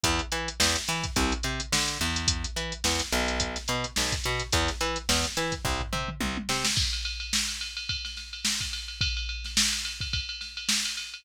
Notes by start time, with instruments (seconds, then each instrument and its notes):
0.04 electric bass (finger) E2, kick, closed hi-hat
0.19 closed hi-hat
0.32 electric bass (finger) E3, closed hi-hat
0.48 closed hi-hat
0.60 electric bass (finger) E2, snare
0.76 snare, closed hi-hat
0.88 electric bass (finger) E3, closed hi-hat
1.04 kick, closed hi-hat
1.16 electric bass (finger) C2, kick, closed hi-hat
1.32 closed hi-hat
1.43 electric bass (finger) C3, closed hi-hat
1.60 closed hi-hat
1.72 electric bass (finger) D3, snare
1.88 closed hi-hat
2.01 electric bass (finger) E2, closed hi-hat
2.16 closed hi-hat
2.28 kick, closed hi-hat
2.44 closed hi-hat
2.56 electric bass (finger) E3, closed hi-hat
2.72 closed hi-hat
2.84 electric bass (finger) E2, snare
2.99 closed hi-hat
3.12 electric bass (finger) B1, snare, closed hi-hat
3.28 closed hi-hat
3.40 kick, closed hi-hat
3.56 snare, closed hi-hat
3.68 electric bass (finger) B2, closed hi-hat
3.84 closed hi-hat
3.96 electric bass (finger) B1, snare
4.12 kick, closed hi-hat
4.24 electric bass (finger) B2, closed hi-hat
4.39 closed hi-hat
4.52 electric bass (finger) E2, kick, closed hi-hat
4.68 snare, closed hi-hat
4.81 electric bass (finger) E3, closed hi-hat
4.96 closed hi-hat
5.09 electric bass (finger) E2, snare
5.24 closed hi-hat
5.37 electric bass (finger) E3, closed hi-hat
5.52 kick, closed hi-hat
5.65 electric bass (finger) C2, kick, floor tom
5.81 floor tom
5.93 electric bass (finger) C3, mid tom
6.08 mid tom
6.20 electric bass (finger) C2, high tom
6.37 high tom
6.49 electric bass (finger) C3, snare
6.64 snare
6.76 kick, crash
6.93 ride
7.05 ride
7.20 ride
7.33 snare
7.48 ride
7.61 ride
7.77 ride
7.89 kick, ride
8.05 snare, ride
8.17 snare, ride
8.33 ride
8.45 snare
8.61 kick, ride
8.73 snare, ride
8.88 ride
9.01 kick, ride
9.17 ride
9.29 ride
9.44 snare, ride
9.57 snare
9.73 ride
9.85 ride
10.00 kick, ride
10.13 kick, ride
10.29 ride
10.41 snare, ride
10.57 ride
10.69 snare
10.85 snare, ride
10.97 ride
11.14 ride